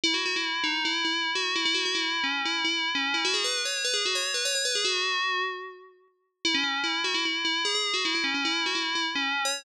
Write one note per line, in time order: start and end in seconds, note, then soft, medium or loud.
0.04 0.13 E4 loud
0.14 0.23 F#4 medium
0.26 0.35 F#4 medium
0.36 0.65 E4 medium
0.64 0.82 D#4 medium
0.85 1.04 E4 medium
1.05 1.31 E4 medium
1.35 1.54 F#4 medium
1.55 1.65 E4 medium
1.65 1.75 E4 loud
1.74 1.84 F#4 medium
1.85 1.95 F#4 medium
1.95 2.23 E4 medium
2.24 2.41 C#4 medium
2.45 2.63 E4 medium
2.64 2.90 E4 medium
2.95 3.14 C#4 medium
3.14 3.23 E4 medium
3.25 3.34 F#4 loud
3.34 3.43 G#4 medium
3.44 3.61 B4 medium
3.65 3.83 C#5 medium
3.84 3.94 B4 medium
3.94 4.03 G#4 medium
4.05 4.15 F#4 medium
4.15 4.32 C#5 medium
4.34 4.44 B4 medium
4.45 4.54 C#5 medium
4.55 4.65 C#5 medium
4.65 4.74 B4 medium
4.75 4.85 G#4 medium
4.84 5.42 F#4 loud
6.45 6.54 E4 medium
6.54 6.63 C#4 loud
6.64 6.81 C#4 medium
6.84 7.01 E4 medium
7.04 7.14 F#4 medium
7.14 7.24 E4 medium
7.25 7.43 E4 medium
7.45 7.62 E4 medium
7.65 7.74 G#4 medium
7.75 7.93 G#4 medium
7.94 8.03 F#4 medium
8.05 8.14 E4 medium
8.15 8.24 E4 medium
8.24 8.33 C#4 medium
8.34 8.44 C#4 medium
8.45 8.63 E4 medium
8.66 8.75 F#4 medium
8.75 8.94 E4 medium
8.95 9.05 E4 medium
9.15 9.43 C#4 medium
9.45 9.63 C#5 medium